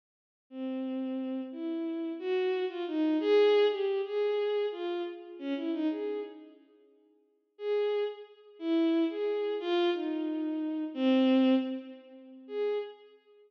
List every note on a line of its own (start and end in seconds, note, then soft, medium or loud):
0.50 1.41 C4 medium
1.52 2.12 E4 medium
2.19 2.65 F#4 medium
2.68 2.84 F4 medium
2.87 3.17 D#4 medium
3.20 3.66 G#4 loud
3.70 4.01 G4 medium
4.05 4.66 G#4 medium
4.71 5.02 F4 medium
5.39 5.54 C#4 medium
5.56 5.71 E4 medium
5.73 5.88 D#4 medium
5.90 6.20 G#4 medium
7.58 8.04 G#4 medium
8.59 9.04 E4 medium
9.10 9.55 G#4 medium
9.60 9.90 F4 loud
9.93 10.84 D#4 medium
10.94 11.55 C4 loud
12.47 12.78 G#4 medium